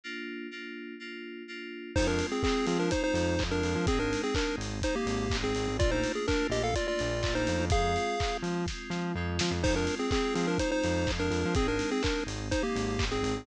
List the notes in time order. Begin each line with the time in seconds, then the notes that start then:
0.04 A#3 D4 F4
0.51 A#3 D4 F4
1.00 A#3 D4 F4
1.48 A#3 D4 F4
1.95 F2 G#3 C4 D#4 F4 C5, kick, crash
2.07 D4 A#4
2.19 open hi-hat
2.32 C4 G#4
2.43 G#3 C4 F4 G#4, kick, clap
2.67 F3 C4 G#4, open hi-hat
2.79 D4 A#4
2.91 G#3 C4 D#4 F4 C5, kick, closed hi-hat
3.04 D#4 C5
3.14 F2, open hi-hat
3.39 F2 G#3 C4 F4, kick, clap
3.51 D4 A#4
3.63 F2, open hi-hat
3.75 F3
3.87 G#1 G#3 C4 D#4 G#4, kick, closed hi-hat
3.99 D4 A#4
4.13 open hi-hat
4.24 C4 G#4
4.35 G#3 C4 D4 D#4 A#4, kick, clap
4.58 G#1, open hi-hat
4.82 G#3 C4 D#4 C5, kick, closed hi-hat
4.96 A#3 G4
5.06 G#1, open hi-hat
5.30 G#1 G#3 C4 D#4, kick, clap
5.44 C4 G#4
5.55 G#1, open hi-hat
5.67 G#1
5.79 A#1 A3 A#3 D4 F4 D5, kick, closed hi-hat
5.91 D#4 C5
6.04 open hi-hat
6.15 G#4
6.27 A3 A#3 D4 F4 A#4, kick, clap
6.50 A#1 G4 D#5, open hi-hat
6.63 A4 F5
6.74 A3 A#3 D4 F4 D5, kick, closed hi-hat
6.88 F4 D5
6.99 A#1, open hi-hat
7.23 A#1 A3 A#3 D4 F4, kick, clap
7.35 D#4 C5
7.47 F2, open hi-hat
7.59 F2
7.70 F2 G#3 C4 F4 G#4 F5, kick, closed hi-hat
7.96 open hi-hat
8.20 G#3 C4 F4, kick, clap
8.43 F3, open hi-hat
8.67 G#3 C4 F4, kick, snare
8.90 F3, snare
9.15 F2 G#3 C4 F4
9.39 F3, snare
9.51 F2
9.62 F2 G#3 C4 D#4 F4 C5, kick, crash
9.76 D4 A#4
9.87 open hi-hat
9.99 C4 G#4
10.11 G#3 C4 F4 G#4, kick, clap
10.35 F3 C4 G#4, open hi-hat
10.47 D4 A#4
10.58 G#3 C4 D#4 F4 C5, kick, closed hi-hat
10.71 D#4 C5
10.84 F2, open hi-hat
11.06 F2 G#3 C4 F4, kick, clap
11.19 D4 A#4
11.31 F2, open hi-hat
11.45 F3
11.55 G#1 G#3 C4 D#4 G#4, kick, closed hi-hat
11.68 D4 A#4
11.79 open hi-hat
11.91 C4 G#4
12.03 G#3 C4 D4 D#4 A#4, kick, clap
12.27 G#1, open hi-hat
12.51 G#3 C4 D#4 C5, kick, closed hi-hat
12.63 A#3 G4
12.76 G#1, open hi-hat
12.98 G#1 G#3 C4 D#4, kick, clap
13.11 C4 G#4
13.23 G#1, open hi-hat
13.37 G#1